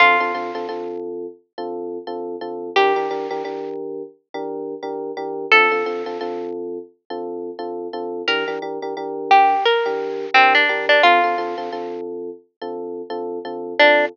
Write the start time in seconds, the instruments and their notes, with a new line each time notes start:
0.00 electric piano 1 D3 C4 F4 A4, pizzicato strings F4
0.20 electric piano 1 D3 C4 F4 A4
0.34 electric piano 1 D3 C4 F4 A4
0.55 electric piano 1 D3 C4 F4 A4
0.69 electric piano 1 D3 C4 F4 A4
1.58 electric piano 1 D3 C4 F4 A4
2.07 electric piano 1 D3 C4 F4 A4
2.41 electric piano 1 D3 C4 F4 A4
2.76 electric piano 1 E3 D4 G4 A#4, pizzicato strings G4
2.96 electric piano 1 E3 D4 G4 A#4
3.11 electric piano 1 E3 D4 G4 A#4
3.30 electric piano 1 E3 D4 G4 A#4
3.45 electric piano 1 E3 D4 G4 A#4
4.34 electric piano 1 E3 D4 G4 A#4
4.83 electric piano 1 E3 D4 G4 A#4
5.17 electric piano 1 E3 D4 G4 A#4
5.52 electric piano 1 D3 C4 F4 A4, pizzicato strings A4
5.72 electric piano 1 D3 C4 F4 A4
5.86 electric piano 1 D3 C4 F4 A4
6.06 electric piano 1 D3 C4 F4 A4
6.21 electric piano 1 D3 C4 F4 A4
7.10 electric piano 1 D3 C4 F4 A4
7.59 electric piano 1 D3 C4 F4 A4
7.93 electric piano 1 D3 C4 F4 A4
8.28 electric piano 1 E3 D4 G4 A#4, pizzicato strings A#4
8.48 electric piano 1 E3 D4 G4 A#4
8.62 electric piano 1 E3 D4 G4 A#4
8.82 electric piano 1 E3 D4 G4 A#4
8.97 electric piano 1 E3 D4 G4 A#4
9.31 pizzicato strings G4
9.65 pizzicato strings A#4
9.86 electric piano 1 E3 D4 G4 A#4
10.34 electric piano 1 E3 D4 G4 A#4, pizzicato strings C4
10.55 pizzicato strings D4
10.69 electric piano 1 E3 D4 G4 A#4
10.89 pizzicato strings D4
11.03 electric piano 1 D3 C4 F4 A4, pizzicato strings F4
11.24 electric piano 1 D3 C4 F4 A4
11.38 electric piano 1 D3 C4 F4 A4
11.58 electric piano 1 D3 C4 F4 A4
11.72 electric piano 1 D3 C4 F4 A4
12.61 electric piano 1 D3 C4 F4 A4
13.10 electric piano 1 D3 C4 F4 A4
13.45 electric piano 1 D3 C4 F4 A4
13.79 electric piano 1 D3 C4 F4 A4, pizzicato strings D4